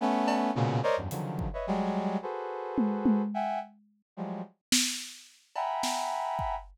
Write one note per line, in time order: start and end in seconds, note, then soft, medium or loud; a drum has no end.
0.01 0.51 A3 loud
0.01 0.51 B3 loud
0.01 0.51 C#4 loud
0.28 cowbell loud
0.55 0.80 A#2 loud
0.55 0.80 B2 loud
0.55 0.80 C#3 loud
0.55 high tom medium
0.83 0.96 A#4 loud
0.83 0.96 C5 loud
0.83 0.96 C#5 loud
0.83 0.96 D5 loud
0.83 0.96 D#5 loud
0.97 1.09 E2 medium
0.97 1.09 F#2 medium
0.97 1.09 G2 medium
1.10 1.48 C#3 medium
1.10 1.48 D3 medium
1.10 1.48 D#3 medium
1.10 1.48 F3 medium
1.10 1.48 F#3 medium
1.10 closed hi-hat medium
1.39 kick medium
1.53 1.66 B4 medium
1.53 1.66 C#5 medium
1.53 1.66 D#5 medium
1.53 1.66 E5 medium
1.67 2.17 F#3 loud
1.67 2.17 G3 loud
1.67 2.17 G#3 loud
2.22 3.22 F#4 medium
2.22 3.22 G#4 medium
2.22 3.22 A4 medium
2.22 3.22 B4 medium
2.22 3.22 C5 medium
2.78 high tom loud
3.06 high tom loud
3.34 3.59 E5 medium
3.34 3.59 F#5 medium
3.34 3.59 G5 medium
3.34 3.59 G#5 medium
4.17 4.42 F3 medium
4.17 4.42 F#3 medium
4.17 4.42 G3 medium
4.17 4.42 G#3 medium
4.72 snare loud
5.55 6.55 E5 medium
5.55 6.55 F#5 medium
5.55 6.55 G5 medium
5.55 6.55 G#5 medium
5.55 6.55 A#5 medium
5.55 6.55 B5 medium
5.55 cowbell medium
5.83 snare medium
6.39 kick medium